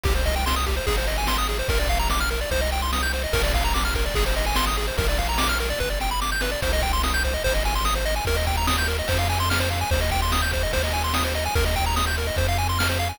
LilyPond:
<<
  \new Staff \with { instrumentName = "Lead 1 (square)" } { \time 4/4 \key c \minor \tempo 4 = 146 g'16 c''16 ees''16 g''16 c'''16 ees'''16 g'16 c''16 aes'16 c''16 ees''16 aes''16 c'''16 ees'''16 aes'16 c''16 | bes'16 d''16 f''16 bes''16 d'''16 f'''16 bes'16 d''16 c''16 ees''16 g''16 c'''16 ees'''16 g'''16 c''16 ees''16 | bes'16 d''16 f''16 bes''16 d'''16 f'''16 bes'16 d''16 aes'16 c''16 ees''16 aes''16 c'''16 ees'''16 aes'16 c''16 | bes'16 d''16 f''16 bes''16 d'''16 f'''16 bes'16 d''16 b'16 d''16 g''16 b''16 d'''16 g'''16 b'16 d''16 |
c''16 ees''16 g''16 c'''16 ees'''16 g'''16 c''16 ees''16 c''16 ees''16 aes''16 c'''16 ees'''16 c''16 ees''16 aes''16 | bes'16 ees''16 g''16 bes''16 ees'''16 g'''16 bes'16 ees''16 c''16 f''16 aes''16 c'''16 f'''16 c''16 f''16 aes''16 | c''16 ees''16 g''16 c'''16 ees'''16 g'''16 c''16 ees''16 c''16 ees''16 aes''16 c'''16 ees'''16 c''16 ees''16 aes''16 | bes'16 ees''16 g''16 bes''16 ees'''16 g'''16 bes'16 ees''16 c''16 f''16 aes''16 c'''16 f'''16 c''16 f''16 aes''16 | }
  \new Staff \with { instrumentName = "Synth Bass 1" } { \clef bass \time 4/4 \key c \minor c,2 aes,,2 | bes,,2 c,2 | bes,,2 aes,,2 | bes,,2 g,,2 |
c,2 aes,,2 | ees,2 f,2 | ees,2 ees,2 | ees,2 f,2 | }
  \new DrumStaff \with { instrumentName = "Drums" } \drummode { \time 4/4 <cymc bd>8 <bd cymr>8 sn8 <bd cymr>8 <bd cymr>8 cymr8 sn8 cymr8 | <bd cymr>8 <bd cymr>8 sn8 cymr8 <bd cymr>8 cymr8 sn8 cymr8 | <bd cymr>8 <bd cymr>8 sn8 <bd cymr>8 <bd cymr>8 cymr8 sn8 cymr8 | <bd cymr>8 <bd cymr>8 sn8 cymr8 <bd sn>8 sn8 sn8 sn8 |
<bd cymr>8 <bd cymr>8 sn8 <bd cymr>8 <bd cymr>8 cymr8 sn8 cymr8 | <bd cymr>8 <bd cymr>8 sn8 cymr8 <bd cymr>8 cymr8 sn8 cymr8 | <bd cymr>8 <bd cymr>8 sn8 <bd cymr>8 <bd cymr>8 cymr8 sn8 cymr8 | <bd cymr>8 <bd cymr>8 sn8 cymr8 <bd cymr>8 cymr8 sn8 cymr8 | }
>>